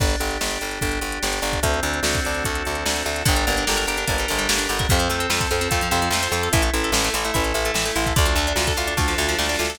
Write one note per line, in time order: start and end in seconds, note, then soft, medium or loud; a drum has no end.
0.00 0.16 G1 medium
0.00 0.40 D4 medium
0.00 kick loud
0.00 crash medium
0.10 closed hi-hat medium
0.20 0.38 G1 medium
0.20 0.62 G4 medium
0.20 closed hi-hat medium
0.31 closed hi-hat medium
0.41 0.58 G1 medium
0.41 0.82 D4 medium
0.41 snare medium
0.51 closed hi-hat medium
0.61 0.79 G1 medium
0.61 1.03 G4 medium
0.61 closed hi-hat medium
0.71 closed hi-hat medium
0.81 0.99 G1 medium
0.81 1.42 D4 medium
0.81 kick medium
0.81 closed hi-hat medium
0.91 closed hi-hat medium
1.01 1.19 G1 medium
1.01 1.21 G4 medium
1.01 closed hi-hat medium
1.12 closed hi-hat medium
1.22 1.40 G1 medium
1.22 1.61 G4 medium
1.22 snare medium
1.33 closed hi-hat medium
1.42 1.60 G1 medium
1.42 1.62 D4 medium
1.42 closed hi-hat medium
1.53 kick medium
1.53 closed hi-hat medium
1.63 1.80 D2 medium
1.63 2.44 C4 medium
1.63 kick medium
1.63 closed hi-hat loud
1.74 closed hi-hat medium
1.83 2.00 D2 medium
1.83 2.65 D4 medium
1.83 closed hi-hat medium
1.94 closed hi-hat medium
2.03 2.20 D2 medium
2.03 2.85 F#4 medium
2.03 snare loud
2.15 kick medium
2.15 closed hi-hat medium
2.24 2.44 D2 medium
2.24 3.06 A4 medium
2.24 closed hi-hat medium
2.35 closed hi-hat medium
2.44 2.63 D2 medium
2.44 3.22 C4 medium
2.44 kick medium
2.44 closed hi-hat medium
2.55 closed hi-hat medium
2.65 2.84 D2 medium
2.65 3.23 D4 medium
2.65 closed hi-hat medium
2.75 closed hi-hat medium
2.86 3.03 D2 medium
2.86 3.24 F#4 medium
2.86 snare loud
2.96 closed hi-hat medium
3.06 3.23 D2 medium
3.06 3.26 A4 medium
3.06 closed hi-hat medium
3.16 closed hi-hat medium
3.25 3.45 G1 medium
3.25 3.35 D3 loud
3.25 3.66 D4 medium
3.25 kick loud
3.25 closed hi-hat loud
3.36 3.45 G3 medium
3.36 closed hi-hat medium
3.46 3.65 G1 medium
3.46 3.56 A#3 medium
3.46 4.28 A#4 medium
3.46 closed hi-hat medium
3.57 3.67 D4 medium
3.57 closed hi-hat medium
3.66 3.86 G1 medium
3.66 4.07 D4 medium
3.66 3.77 G4 medium
3.66 snare loud
3.77 3.86 A#4 medium
3.77 closed hi-hat medium
3.87 4.05 G1 medium
3.87 3.97 G4 medium
3.87 4.48 G4 medium
3.87 closed hi-hat medium
3.97 4.07 D4 medium
3.97 closed hi-hat medium
4.07 4.26 G1 medium
4.07 4.17 A#3 medium
4.07 4.69 D4 medium
4.07 kick medium
4.07 closed hi-hat medium
4.18 4.29 G3 medium
4.18 closed hi-hat medium
4.28 4.48 G1 medium
4.28 4.38 D3 medium
4.28 4.87 A#4 medium
4.28 closed hi-hat medium
4.38 4.48 G3 medium
4.38 closed hi-hat medium
4.49 4.67 G1 medium
4.49 4.58 A#3 medium
4.49 4.87 G4 medium
4.49 snare loud
4.58 4.67 D4 medium
4.58 closed hi-hat medium
4.69 4.87 G1 medium
4.69 4.89 D4 medium
4.69 4.78 G4 medium
4.69 closed hi-hat medium
4.79 4.89 A#4 medium
4.79 kick medium
4.79 closed hi-hat medium
4.89 5.09 F2 medium
4.89 4.99 C3 loud
4.89 5.30 C4 medium
4.89 kick medium
4.89 closed hi-hat medium
4.99 5.09 F3 medium
4.99 closed hi-hat medium
5.09 5.27 F2 medium
5.09 5.20 A3 medium
5.09 5.92 A4 medium
5.09 closed hi-hat medium
5.20 5.29 C4 medium
5.20 closed hi-hat medium
5.30 5.47 F2 medium
5.30 5.71 C4 medium
5.30 5.39 F4 loud
5.30 snare loud
5.41 5.50 A4 loud
5.41 kick medium
5.41 closed hi-hat medium
5.51 5.69 F2 medium
5.51 5.60 F4 medium
5.51 6.13 F4 medium
5.51 closed hi-hat medium
5.61 5.70 C4 medium
5.61 closed hi-hat medium
5.71 5.89 F2 medium
5.71 5.81 A3 loud
5.71 6.32 C4 medium
5.71 kick medium
5.71 closed hi-hat medium
5.81 5.91 F3 medium
5.81 closed hi-hat medium
5.91 6.09 F2 medium
5.91 6.00 C3 loud
5.91 6.51 A4 medium
5.91 closed hi-hat medium
6.02 6.11 F3 medium
6.02 closed hi-hat medium
6.11 6.28 F2 medium
6.11 6.22 A3 medium
6.11 6.52 F4 medium
6.11 snare loud
6.23 6.32 C4 medium
6.23 closed hi-hat medium
6.32 6.49 F2 medium
6.32 6.52 C4 medium
6.32 6.42 F4 medium
6.32 closed hi-hat medium
6.43 6.53 A4 medium
6.43 closed hi-hat medium
6.53 6.70 A1 medium
6.53 6.62 E3 loud
6.53 6.94 E4 medium
6.53 kick medium
6.53 closed hi-hat loud
6.62 6.71 A3 medium
6.62 closed hi-hat medium
6.74 6.91 A1 medium
6.74 6.83 E4 medium
6.74 7.13 A4 medium
6.74 closed hi-hat medium
6.84 6.93 A4 medium
6.84 closed hi-hat medium
6.92 7.10 A1 medium
6.92 7.34 E4 medium
6.92 7.04 E4 medium
6.92 snare loud
7.04 7.14 A3 medium
7.04 closed hi-hat medium
7.14 7.31 A1 medium
7.14 7.24 E3 loud
7.14 7.55 A4 medium
7.14 closed hi-hat medium
7.25 7.34 A3 medium
7.25 closed hi-hat medium
7.34 7.53 A1 medium
7.34 7.43 E4 medium
7.34 7.95 E4 medium
7.34 kick medium
7.34 closed hi-hat medium
7.44 7.54 A4 medium
7.44 closed hi-hat medium
7.54 7.71 A1 medium
7.54 7.64 E4 medium
7.54 7.75 A4 medium
7.54 closed hi-hat medium
7.65 7.75 A3 medium
7.65 closed hi-hat medium
7.74 7.91 A1 medium
7.74 7.85 E3 medium
7.74 8.14 A4 medium
7.74 snare loud
7.85 7.95 A3 medium
7.85 closed hi-hat medium
7.96 8.13 A1 medium
7.96 8.05 E4 medium
7.96 8.15 E4 medium
7.96 closed hi-hat medium
8.06 8.16 A4 medium
8.06 kick medium
8.06 closed hi-hat medium
8.16 8.35 D2 medium
8.16 8.25 D3 loud
8.16 8.58 D4 medium
8.16 kick loud
8.16 closed hi-hat medium
8.25 8.35 F3 medium
8.25 closed hi-hat medium
8.36 8.53 D2 medium
8.36 8.47 A3 medium
8.36 9.18 A4 medium
8.36 closed hi-hat medium
8.47 8.57 D4 medium
8.47 closed hi-hat medium
8.56 8.73 D2 medium
8.56 8.99 D4 medium
8.56 8.66 F4 medium
8.56 snare loud
8.67 8.77 A4 medium
8.67 kick medium
8.67 closed hi-hat medium
8.77 8.94 D2 medium
8.77 9.38 F4 medium
8.77 8.87 F4 medium
8.77 closed hi-hat medium
8.87 8.97 D4 medium
8.87 closed hi-hat medium
8.97 9.14 D2 medium
8.97 9.07 A3 medium
8.97 9.59 D4 medium
8.97 kick medium
8.97 snare medium
9.08 9.17 F3 medium
9.08 snare medium
9.18 9.35 D2 medium
9.18 9.27 D3 medium
9.18 9.76 A4 medium
9.18 snare medium
9.29 9.38 F3 medium
9.29 snare medium
9.38 9.56 D2 medium
9.38 9.48 A3 medium
9.38 9.77 F4 medium
9.38 snare medium
9.44 snare medium
9.49 9.58 D4 medium
9.49 snare medium
9.54 snare medium
9.59 9.77 D2 medium
9.59 9.79 D4 medium
9.59 9.68 F4 medium
9.59 snare medium
9.65 snare medium
9.70 9.79 A4 medium
9.70 snare medium
9.75 snare loud